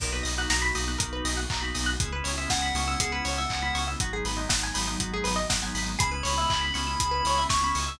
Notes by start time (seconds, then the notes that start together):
0.00 B1 A#3 B3 D#4 F#4 A#4, kick, crash
0.12 A#3 B3 D#4 F#4 B4
0.23 B1 D#5, open hi-hat
0.38 A#3 B3 D#4 F#4 F#5
0.50 B1 A#5, snare
0.62 B5
0.75 B1 A#3 B3 D#4 F#4 D#6, open hi-hat
0.88 A#3 B3 D#4 F#4 F#6
0.98 B1 A#3 B3 D#4 F#4 A#4, kick, closed hi-hat
1.13 B4
1.25 B1 D#5, open hi-hat
1.37 F#5
1.50 B1 A#3 B3 D#4 F#4 A#5, kick, clap
1.61 A#3 B3 D#4 F#4 B5
1.74 B1 D#6, open hi-hat
1.86 F#6
2.00 C#2 G#3 B3 C#4 E4 G#4, kick, closed hi-hat
2.12 G#3 B3 C#4 E4 B4
2.24 C#2 C#5, open hi-hat
2.38 G#3 B3 C#4 E4 E5
2.50 C#2 F#5 G#5, kick, snare
2.62 B5
2.74 C#2 G#3 B3 C#4 E4 C#6, open hi-hat
2.88 G#3 B3 C#4 E4 E6
2.99 C#2 G#3 B3 C#4 E4 G#4, kick, closed hi-hat
3.12 B4
3.25 C#2 C#5, open hi-hat
3.38 E5
3.50 C#2 G#3 B3 C#4 E4 G#5, kick, clap
3.62 G#3 B3 C#4 E4 B5
3.74 C#2 C#6, open hi-hat
3.88 E6
4.00 G#1 F#3 G#3 B3 D#4 F#4, kick, closed hi-hat
4.12 F#3 G#3 B3 D#4 G#4
4.25 G#1 B4, open hi-hat
4.37 F#3 G#3 B3 D#4 D#5
4.49 G#1 F#5, kick, snare
4.63 G#5
4.74 G#1 F#3 G#3 B3 D#4 B5, open hi-hat
4.87 F#3 G#3 B3 D#4 D#6
5.00 G#1 F#3 G#3 B3 D#4 F#4, kick, closed hi-hat
5.14 G#4
5.24 G#1 B4, open hi-hat
5.36 D#5
5.50 G#1 F#3 G#3 B3 D#4 F#5, kick, snare
5.62 F#3 G#3 B3 D#4 G#5
5.75 G#1 B5, open hi-hat
5.86 D#6
5.99 C#2 G#3 B3 C#4 E4 G#4 B5, kick, closed hi-hat
6.11 G#3 B3 C#4 E4 B4
6.23 C#2 C#5, open hi-hat
6.38 G#3 B3 C#4 E4 E5
6.50 C#2 G#5, kick, clap
6.61 B5
6.74 C#2 G#3 B3 C#4 E4 C#6, open hi-hat
6.87 G#3 B3 C#4 E4 E6
7.00 C#2 G#3 B3 C#4 E4 G#4, kick, closed hi-hat
7.11 B4
7.25 C#2 C#5, open hi-hat
7.38 E5
7.49 C#2 G#3 B3 C#4 E4 G#5 C#6, kick, snare
7.62 G#3 B3 C#4 E4 B5
7.75 C#2 C#6, open hi-hat
7.88 E6